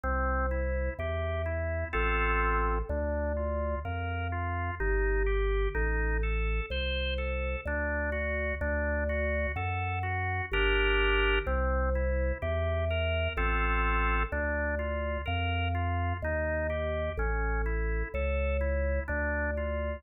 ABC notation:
X:1
M:3/4
L:1/8
Q:1/4=63
K:Gm
V:1 name="Drawbar Organ"
C =E G E [CFA]2 | D F B F E G | E A c A D ^F | D ^F A F [DGB]2 |
C =E G B [CFA]2 | D F B F E G | ^C =E A E D F |]
V:2 name="Drawbar Organ" clef=bass
C,,2 =E,,2 A,,,2 | D,,2 F,,2 G,,,2 | A,,,2 C,,2 D,,2 | D,,2 ^F,,2 G,,,2 |
C,,2 =E,,2 A,,,2 | D,,2 F,,2 E,,2 | A,,,2 ^C,,2 D,,2 |]